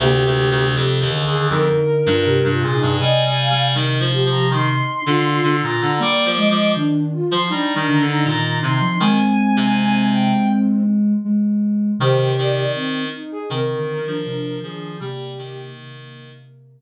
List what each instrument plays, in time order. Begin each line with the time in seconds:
0.00 clarinet D2, ocarina C3 G4, flute A#3
0.25 clarinet D2
0.50 clarinet D2
0.75 clarinet F2, flute G4
1.00 clarinet D#2
1.13 ocarina D3, flute G#4
1.25 clarinet D#2
1.30 ocarina G#4
1.49 clarinet F2, flute D#4, ocarina A#4
2.06 clarinet G2, flute F4
2.25 ocarina C3, flute G4
2.44 clarinet G2
2.50 flute F4
2.62 clarinet A#2, ocarina G#4
2.74 flute D#4
2.81 clarinet G2
2.99 ocarina C3 G#5, clarinet G3, flute D#5
3.25 clarinet G3
3.38 flute F5
3.50 clarinet G3
3.74 clarinet D#3, flute D#4
4.00 clarinet F3
4.13 flute G4
4.25 clarinet F3
4.31 ocarina A#5
4.50 clarinet D#3, flute D#4, ocarina C6
5.06 clarinet D3, flute F4
5.43 clarinet D3
5.62 clarinet A#2, flute F4, ocarina A#5
5.81 clarinet D3
5.99 clarinet G3, ocarina A#3 D6, flute D5
6.25 clarinet F3
6.37 ocarina G#3, flute D#5
6.50 clarinet F3
6.75 ocarina D#3, flute D4
7.12 flute F4
7.31 clarinet F3, ocarina C6
7.50 clarinet G3, flute D4, ocarina D#4 A#5
7.75 clarinet D#3
7.88 ocarina D3
8.00 clarinet D3
8.07 flute D#4
8.24 clarinet A#2, ocarina D#3
8.62 clarinet C3, flute D#4, ocarina C6
8.81 ocarina F3
9.00 clarinet D#3, ocarina G#3 G#5, flute C4
9.57 clarinet C3
10.12 ocarina G5
11.25 ocarina G#3
11.99 ocarina C3 G4, clarinet D#3, flute C5
12.19 ocarina C3
12.38 clarinet D#3, flute D5
12.74 flute C4
13.13 flute D#4
13.31 ocarina G#4
13.50 ocarina C3 A#4, clarinet D#3, flute C4
13.74 ocarina D3
13.99 ocarina D#3
14.06 clarinet F3, flute D4
14.25 ocarina C3
14.61 ocarina D#3 G#4, clarinet F3, flute D4
15.00 ocarina C3 G4, clarinet G3, flute A#3
15.38 clarinet D#3
15.76 ocarina C3